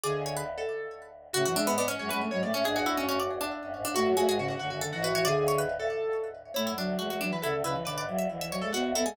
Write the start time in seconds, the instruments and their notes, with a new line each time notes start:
0.04 choir aahs D1 D2, flute D3, pizzicato strings G#4, harpsichord D5
0.15 choir aahs D1 D2
0.26 harpsichord C#5
0.37 harpsichord B4
0.58 pizzicato strings A4
1.33 choir aahs A2 A3, flute C#3, pizzicato strings F#4, harpsichord F#4
1.45 choir aahs F#2 F#3, flute E3, harpsichord F#4
1.55 choir aahs E2 E3, flute G#3, harpsichord D4, pizzicato strings E5
1.67 choir aahs G#2 G#3, harpsichord B3
1.78 harpsichord B3, pizzicato strings D5
1.88 harpsichord C#4, pizzicato strings C#5
1.99 choir aahs F#2 F#3, flute G#3, pizzicato strings C#5
2.09 choir aahs F#2 F#3, flute G#3, harpsichord C#4, pizzicato strings B4
2.21 flute A3
2.31 choir aahs G#2 G#3, flute F#3, pizzicato strings C#5
2.42 choir aahs A2 A3, flute A3, pizzicato strings D5
2.54 choir aahs A2 A3, harpsichord C#4, pizzicato strings C#5
2.64 choir aahs G#1 G#2, flute D4, pizzicato strings G#4, harpsichord G#4
2.76 choir aahs E1 E2, pizzicato strings F#4, harpsichord G#4
2.86 choir aahs D1 D2, harpsichord E4
2.97 choir aahs F#1 F#2, harpsichord C#4
3.09 harpsichord C#4
3.20 harpsichord D5
3.30 choir aahs E1 E2
3.40 choir aahs E1 E2, harpsichord D4
3.63 choir aahs F#1 F#2
3.73 choir aahs G#1 G#2
3.84 choir aahs G#1 G#2, harpsichord D4
3.94 choir aahs A1 A2, flute A3, pizzicato strings F#4, harpsichord F#4
4.06 choir aahs F#2 F#3
4.17 choir aahs E1 E2, flute A3, pizzicato strings F#4, harpsichord G#4
4.28 choir aahs G#1 G#2, flute G#3, harpsichord G#4
4.38 flute C#3, pizzicato strings F#4
4.48 pizzicato strings F#4
4.59 choir aahs F#1 F#2, flute D3, pizzicato strings F#4
4.70 choir aahs F#1 F#2, flute D3, pizzicato strings F#4
4.81 flute D3, harpsichord A4
4.93 choir aahs G#1 G#2, flute E3, pizzicato strings F#4
5.02 choir aahs A1 A2, pizzicato strings F#4, harpsichord B4
5.14 choir aahs A1 A2, flute E3, pizzicato strings F#4, harpsichord C#5
5.25 choir aahs D1 D2, flute D3, pizzicato strings G#4, harpsichord D5
5.37 choir aahs D1 D2
5.48 harpsichord C#5
5.58 harpsichord B4
5.80 pizzicato strings A4
6.54 choir aahs A2 A3, flute A3, harpsichord E4, pizzicato strings C#5
6.67 choir aahs F#2 F#3, harpsichord E4
6.77 choir aahs D2 D3, flute F#3, harpsichord D4
6.99 choir aahs E2 E3, flute G#3, harpsichord F#4
7.10 flute G#3, harpsichord F#4
7.21 flute F#3, harpsichord D4
7.31 flute E3, pizzicato strings B4
7.42 choir aahs D2 D3, flute C#3, harpsichord E4, pizzicato strings A4
7.54 choir aahs D2 D3
7.64 choir aahs C#2 C#3, flute C#3, harpsichord E4, pizzicato strings B4
7.74 flute E3
7.85 choir aahs B1 B2, flute D3, pizzicato strings B4, harpsichord D5
7.97 choir aahs G#1 G#2, harpsichord D5
8.08 choir aahs E1 E2, flute F#3
8.18 harpsichord E5
8.30 choir aahs D1 D2, flute E3
8.40 flute E3, harpsichord E5
8.51 flute F#3, harpsichord C#5
8.62 flute G#3, pizzicato strings A4
8.73 choir aahs D1 D2, flute B3, pizzicato strings F#4, harpsichord F#4
8.85 choir aahs D1 D2
8.95 choir aahs D1 D2, flute B3, harpsichord E4, pizzicato strings A4
9.05 flute G#3, harpsichord G#4